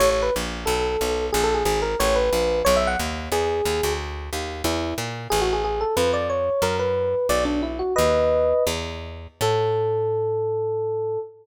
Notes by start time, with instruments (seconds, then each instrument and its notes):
0.00 electric bass (finger) A1, electric piano 1 C#5
0.10 electric piano 1 C#5
0.23 electric piano 1 B4
0.36 electric bass (finger) A#1
0.66 electric bass (finger) B1, electric piano 1 A4
1.01 electric bass (finger) B1
1.33 electric bass (finger) A#1, electric piano 1 G#4
1.44 electric piano 1 A4
1.54 electric piano 1 G#4
1.65 electric bass (finger) G#1, electric piano 1 G#4
1.82 electric piano 1 A#4
2.00 electric bass (finger) A1, electric piano 1 C#5
2.16 electric piano 1 B4
2.33 electric bass (finger) A#1
2.65 electric bass (finger) B1, electric piano 1 C#5
2.76 electric piano 1 E5
2.87 electric piano 1 F#5
2.99 electric bass (finger) D#2
3.32 electric bass (finger) E2, electric piano 1 G#4
3.65 electric bass (finger) D#2
3.83 electric bass (finger) D2
4.33 electric bass (finger) D#2
4.64 electric bass (finger) E2, electric piano 1 E4
4.98 electric bass (finger) A#2
5.30 electric bass (finger) A1, electric piano 1 G#4
5.41 electric piano 1 F#4
5.53 electric piano 1 G#4
5.64 electric piano 1 G#4
5.81 electric piano 1 A4
5.97 electric bass (finger) F2, electric piano 1 B4
6.13 electric piano 1 D5
6.30 electric piano 1 C#5
6.62 electric bass (finger) F#2, electric piano 1 A#4
6.79 electric piano 1 B4
7.29 electric bass (finger) B1, electric piano 1 D5
7.45 electric piano 1 D4
7.63 electric piano 1 E4
7.79 electric piano 1 F#4
7.96 electric bass (finger) D#2, electric piano 1 B4 D#5
8.67 electric bass (finger) E2
9.41 electric bass (finger) A2, electric piano 1 A4